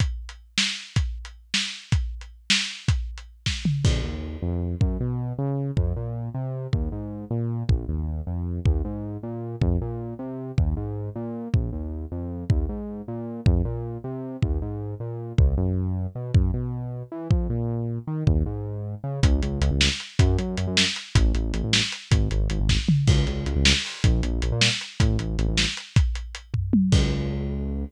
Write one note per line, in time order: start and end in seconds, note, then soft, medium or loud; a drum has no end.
0.00 kick medium
0.00 closed hi-hat medium
0.29 closed hi-hat medium
0.58 snare loud
0.96 kick medium
0.96 closed hi-hat medium
1.25 closed hi-hat medium
1.54 snare loud
1.92 kick loud
1.92 closed hi-hat medium
2.21 closed hi-hat medium
2.50 snare loud
2.88 kick loud
2.88 closed hi-hat medium
3.18 closed hi-hat medium
3.46 kick medium
3.46 snare medium
3.65 mid tom medium
3.84 4.00 A#1 medium
3.84 kick loud
3.84 crash loud
4.04 4.37 D#2 medium
4.42 4.75 F2 medium
4.81 4.97 F#2 medium
4.81 kick loud
5.00 5.33 B2 medium
5.38 5.71 C#3 medium
5.77 5.93 F2 medium
5.77 kick medium
5.96 6.29 A#2 medium
6.34 6.67 C3 medium
6.73 6.89 D#2 medium
6.73 kick medium
6.92 7.25 G#2 medium
7.31 7.63 A#2 medium
7.69 7.85 A#1 medium
7.69 kick loud
7.88 8.21 D#2 medium
8.27 8.60 F2 medium
8.66 8.82 D#2 medium
8.66 kick loud
8.85 9.17 G#2 medium
9.23 9.56 A#2 medium
9.61 9.78 F2 medium
9.61 kick loud
9.81 10.14 A#2 medium
10.19 10.52 C3 medium
10.58 10.74 D#2 medium
10.58 kick loud
10.77 11.10 G#2 medium
11.16 11.48 A#2 medium
11.54 11.70 A#1 medium
11.54 kick medium
11.73 12.05 D#2 medium
12.12 12.44 F2 medium
12.50 12.66 D#2 medium
12.50 kick loud
12.69 13.02 G#2 medium
13.08 13.41 A#2 medium
13.46 13.62 F2 medium
13.46 kick loud
13.65 13.98 A#2 medium
14.04 14.37 C3 medium
14.42 14.59 D#2 medium
14.42 kick medium
14.62 14.95 G#2 medium
15.00 15.33 A#2 medium
15.38 15.54 C#2 loud
15.38 kick loud
15.58 16.07 F#2 medium
16.15 16.32 B2 medium
16.35 16.51 F#2 medium
16.35 kick loud
16.54 17.03 B2 medium
17.12 17.28 E3 medium
17.31 17.47 F2 medium
17.31 kick loud
17.50 17.99 A#2 medium
18.07 18.24 D#3 medium
18.27 18.43 D#2 medium
18.27 kick loud
18.46 18.95 G#2 medium
19.04 19.20 C#3 medium
19.23 19.41 C#2 loud
19.23 kick loud
19.23 closed hi-hat loud
19.42 19.60 C#2 loud
19.42 closed hi-hat medium
19.61 19.70 C#2 loud
19.61 closed hi-hat medium
19.71 19.89 C#2 medium
19.81 snare loud
20.00 closed hi-hat medium
20.19 20.37 F#2 loud
20.19 kick loud
20.19 closed hi-hat loud
20.38 20.56 F#2 medium
20.38 closed hi-hat medium
20.57 20.67 F#2 medium
20.57 closed hi-hat medium
20.67 20.85 F#2 loud
20.77 snare loud
20.96 closed hi-hat medium
21.15 21.32 A1 loud
21.15 kick loud
21.15 closed hi-hat loud
21.35 21.52 A1 medium
21.35 closed hi-hat medium
21.54 21.62 A1 loud
21.54 closed hi-hat medium
21.64 21.81 A1 loud
21.73 snare loud
21.92 closed hi-hat medium
22.11 22.28 G#1 loud
22.11 kick loud
22.11 closed hi-hat loud
22.31 22.48 G#1 loud
22.31 closed hi-hat medium
22.50 22.59 G#1 loud
22.50 closed hi-hat medium
22.60 22.77 G#1 medium
22.69 kick medium
22.69 snare medium
22.89 mid tom loud
23.07 23.25 C#2 loud
23.07 kick loud
23.07 crash loud
23.27 23.45 C#2 medium
23.27 closed hi-hat medium
23.46 23.55 C#2 medium
23.46 closed hi-hat medium
23.56 23.73 C#2 loud
23.65 snare loud
23.85 open hi-hat medium
24.04 24.21 A#1 loud
24.04 kick loud
24.04 closed hi-hat loud
24.23 24.41 A#1 loud
24.23 closed hi-hat medium
24.42 24.51 A#1 medium
24.42 closed hi-hat medium
24.52 24.69 A#2 medium
24.61 snare loud
24.81 closed hi-hat medium
25.00 25.17 A1 loud
25.00 kick loud
25.00 closed hi-hat loud
25.19 25.36 A1 medium
25.19 closed hi-hat medium
25.39 25.47 A1 medium
25.39 closed hi-hat medium
25.48 25.66 A1 loud
25.57 snare loud
25.77 closed hi-hat medium
25.96 kick loud
25.96 closed hi-hat loud
26.15 closed hi-hat medium
26.35 closed hi-hat medium
26.54 kick medium
26.54 floor tom medium
26.73 high tom loud
26.92 27.84 C#2 loud
26.92 kick loud
26.92 crash loud